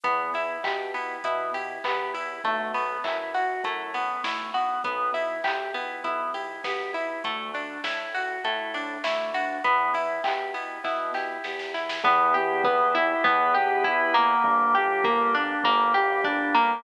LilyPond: <<
  \new Staff \with { instrumentName = "Drawbar Organ" } { \time 4/4 \key e \minor \tempo 4 = 100 b8 e'8 g'8 e'8 b8 e'8 g'8 e'8 | a8 b8 e'8 fis'8 e'8 b8 a8 b8 | b8 e'8 g'8 e'8 b8 e'8 g'8 e'8 | a8 d'8 e'8 fis'8 e'8 d'8 a8 d'8 |
b8 e'8 g'8 e'8 b8 e'8 g'8 e'8 | b8 g'8 b8 e'8 b8 g'8 e'8 bes8~ | bes8 g'8 bes8 d'8 bes8 g'8 d'8 bes8 | }
  \new Staff \with { instrumentName = "Pizzicato Strings" } { \time 4/4 \key e \minor b8 e'8 g'8 b8 e'8 g'8 b8 e'8 | a8 b8 e'8 fis'8 a8 b8 e'8 fis'8 | b8 e'8 g'8 b8 e'8 g'8 b8 e'8 | a8 d'8 e'8 fis'8 a8 d'8 e'8 fis'8 |
b8 e'8 g'8 b8 e'8 g'8 b8 e'8 | b8 g'8 b8 e'8 b8 g'8 e'8 bes8~ | bes8 g'8 bes8 d'8 bes8 g'8 d'8 bes8 | }
  \new Staff \with { instrumentName = "Synth Bass 1" } { \clef bass \time 4/4 \key e \minor e,4 b,4 b,4 e,4 | b,,4 fis,4 fis,4 b,,4 | b,,4 b,,4 b,,4 b,,4 | d,4 a,4 a,4 d,4 |
e,4 b,4 b,4 e,4 | e,2 e,2 | g,,2 g,,2 | }
  \new Staff \with { instrumentName = "Drawbar Organ" } { \time 4/4 \key e \minor r1 | r1 | r1 | r1 |
r1 | <b e' g'>2 <b g' b'>2 | <bes d' g'>2 <g bes g'>2 | }
  \new DrumStaff \with { instrumentName = "Drums" } \drummode { \time 4/4 <hh bd>8 hho8 <hc bd>8 hho8 <hh bd>8 hho8 <hc bd>8 hho8 | <hh bd>8 hho8 <hc bd>8 hho8 <hh bd>8 hho8 <bd sn>8 hho8 | <hh bd>8 hho8 <hc bd>8 hho8 <hh bd>8 hho8 <bd sn>8 hho8 | <hh bd>8 hho8 <bd sn>8 hho8 <hh bd>8 hho8 <bd sn>8 hho8 |
<hh bd>8 hho8 <hc bd>8 hho8 <bd sn>8 sn8 sn16 sn16 sn16 sn16 | bd4 bd4 bd4 bd4 | bd4 bd4 bd4 bd4 | }
>>